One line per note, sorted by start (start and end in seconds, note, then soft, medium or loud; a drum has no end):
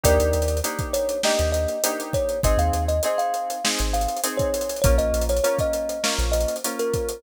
0.04 0.19 D#2 medium
0.04 0.58 A#3 loud
0.04 0.58 D4 loud
0.04 0.58 D#4 loud
0.04 0.58 G4 loud
0.04 0.60 A#4 medium
0.04 0.60 D5 loud
0.04 kick medium
0.04 closed hi-hat loud
0.20 0.33 D#2 medium
0.20 closed hi-hat medium
0.33 0.61 D#2 medium
0.33 closed hi-hat medium
0.42 closed hi-hat medium
0.48 closed hi-hat medium
0.57 closed hi-hat medium
0.64 1.18 A#3 loud
0.64 1.18 D4 loud
0.64 1.18 D#4 medium
0.64 1.18 G4 medium
0.64 closed hi-hat medium
0.79 kick medium
0.79 closed hi-hat medium
0.93 1.22 C#5 medium
0.93 closed hi-hat medium
1.09 closed hi-hat medium
1.23 1.78 A#3 loud
1.23 1.78 D4 medium
1.23 1.78 D#4 medium
1.23 1.78 G4 loud
1.23 1.50 D#5 medium
1.23 snare medium
1.39 1.66 D#2 medium
1.39 closed hi-hat medium
1.52 2.01 D#5 medium
1.52 closed hi-hat medium
1.68 closed hi-hat medium
1.84 2.38 A#3 medium
1.84 2.38 D4 medium
1.84 2.38 D#4 loud
1.84 2.38 G4 loud
1.84 closed hi-hat loud
2.00 closed hi-hat medium
2.13 2.41 C#5 medium
2.13 kick medium
2.13 closed hi-hat medium
2.29 closed hi-hat medium
2.43 2.58 G#1 medium
2.43 2.98 C4 loud
2.43 2.98 D#4 loud
2.43 2.98 G#4 loud
2.43 2.59 D#5 medium
2.43 kick medium
2.43 closed hi-hat medium
2.57 2.71 D#2 medium
2.57 2.84 F5 medium
2.57 closed hi-hat medium
2.73 3.00 D#2 medium
2.73 closed hi-hat medium
2.88 3.03 D#5 medium
2.88 closed hi-hat medium
3.03 3.58 C4 loud
3.03 3.58 D#4 loud
3.03 3.58 G#4 medium
3.03 3.20 D#5 medium
3.03 closed hi-hat medium
3.18 3.68 F5 medium
3.18 closed hi-hat medium
3.34 closed hi-hat medium
3.50 closed hi-hat medium
3.64 4.18 C4 medium
3.64 4.18 D#4 loud
3.64 4.18 G#4 medium
3.64 snare loud
3.79 4.07 G#1 medium
3.79 closed hi-hat medium
3.94 4.21 F5 medium
3.94 closed hi-hat medium
4.01 closed hi-hat medium
4.08 closed hi-hat medium
4.17 closed hi-hat medium
4.23 4.77 C4 loud
4.23 4.77 D#4 medium
4.23 4.77 G#4 medium
4.23 closed hi-hat loud
4.37 4.80 C#5 medium
4.37 kick medium
4.37 closed hi-hat medium
4.54 closed hi-hat medium
4.61 closed hi-hat medium
4.69 closed hi-hat medium
4.76 closed hi-hat medium
4.82 4.99 A#1 medium
4.82 5.38 A#3 loud
4.82 5.38 C#4 loud
4.82 5.38 F4 loud
4.82 4.96 C#5 loud
4.82 kick loud
4.82 closed hi-hat medium
4.98 5.13 A#1 medium
4.98 5.24 D#5 medium
4.98 closed hi-hat medium
5.13 5.40 A#1 medium
5.13 closed hi-hat medium
5.21 closed hi-hat medium
5.29 5.43 C#5 medium
5.29 closed hi-hat medium
5.37 closed hi-hat medium
5.44 5.98 A#3 loud
5.44 5.98 C#4 loud
5.44 5.98 F4 medium
5.44 5.58 C#5 medium
5.44 closed hi-hat medium
5.58 6.14 D#5 medium
5.58 kick medium
5.58 closed hi-hat medium
5.73 closed hi-hat medium
5.89 closed hi-hat medium
6.03 6.57 A#3 loud
6.03 6.57 C#4 loud
6.03 6.57 F4 loud
6.03 snare loud
6.19 6.46 A#1 medium
6.19 closed hi-hat medium
6.32 6.56 D#5 medium
6.32 closed hi-hat medium
6.41 closed hi-hat medium
6.48 closed hi-hat medium
6.56 closed hi-hat medium
6.64 7.18 A#3 medium
6.64 7.18 C#4 loud
6.64 7.18 F4 medium
6.64 closed hi-hat medium
6.79 7.22 A#4 medium
6.79 closed hi-hat medium
6.94 kick medium
6.94 closed hi-hat medium
7.09 closed hi-hat medium